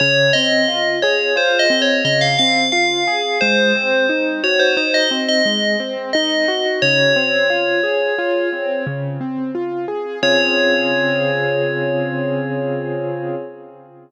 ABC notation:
X:1
M:5/4
L:1/16
Q:1/4=88
K:Db
V:1 name="Tubular Bells"
d2 e4 d2 (3c2 e2 d2 e f f2 f4 | c6 d c c e z e3 z2 e4 | d14 z6 | d20 |]
V:2 name="Acoustic Grand Piano"
D,2 C2 F2 A2 F2 C2 D,2 C2 F2 A2 | A,2 C2 E2 G2 E2 C2 A,2 C2 E2 G2 | D,2 C2 F2 A2 F2 C2 D,2 C2 F2 A2 | [D,CFA]20 |]